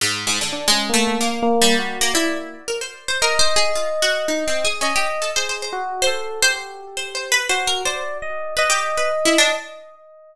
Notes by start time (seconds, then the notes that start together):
0.01 G#2
0.27 G#2
0.41 D3
0.52 D4
0.68 G#3 C#4
0.89 A#3
0.94 A3
1.07 A#3
1.21 A#3
1.42 A#3
1.61 G3
1.79 F#4
2.01 A#3
2.14 E4 D5
2.68 A#4
2.81 C5
3.08 C5
3.22 A#4 D#5
3.39 C5
3.56 G#4
3.75 F4
4.02 F#4
4.28 D#4
4.48 C4
4.65 G#4
4.81 C#4 D#5
4.96 G4
5.22 A4
5.36 G#4 C5
5.49 C5
5.62 C5
5.72 F#4
6.02 C5
6.07 A4
6.42 G4 C5
6.97 C5
7.15 C5
7.32 B4
7.49 F#4 C5
7.67 A#4
7.85 C5 D5
8.22 D#5
8.57 B4 D#5
8.70 G4
8.97 B4
9.25 E4
9.38 D4